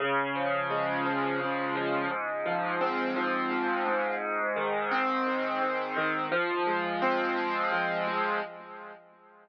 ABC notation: X:1
M:6/8
L:1/8
Q:3/8=57
K:Fm
V:1 name="Acoustic Grand Piano"
D, F, A, F, D, F, | A,, F, C F, A,, A,,- | A,, E, C E, A,, E, | F, A, C A, F, A, |]